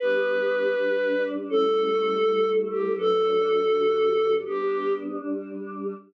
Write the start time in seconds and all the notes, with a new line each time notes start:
0.00 G3 B3 D4 B4
0.76 G3 D4 G4
1.48 G3 A3 C#4 E4 A4
2.24 G3 A3 E4 A4
2.70 G4
2.96 G2 F#3 A3 D4 A4
3.70 G2 D3 F#3 D4
4.45 G3 B3 D4 G4
5.20 G3 D4 G4